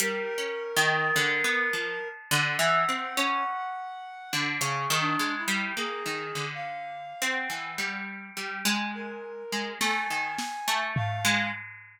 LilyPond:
<<
  \new Staff \with { instrumentName = "Orchestral Harp" } { \time 5/4 \tempo 4 = 52 \tuplet 3/2 { g8 des'8 ees8 } d16 b16 f16 r16 d16 e16 c'16 des'16 r8. d16 des16 ees16 aes16 g16 | bes16 ees16 d8. c'16 e16 g8 g16 aes8. aes16 a16 ees16 r16 a8 aes16 | }
  \new Staff \with { instrumentName = "Clarinet" } { \time 5/4 bes'2 ges''2 \tuplet 3/2 { aes'8 d'8 e'8 } | \tuplet 3/2 { aes'4 f''4 ges''4 } r8. bes'8. aes''4 f''8 | }
  \new DrumStaff \with { instrumentName = "Drums" } \drummode { \time 5/4 hh4 r4 r4 r4 hh4 | r4 r4 r4 r8 sn8 sn8 tomfh8 | }
>>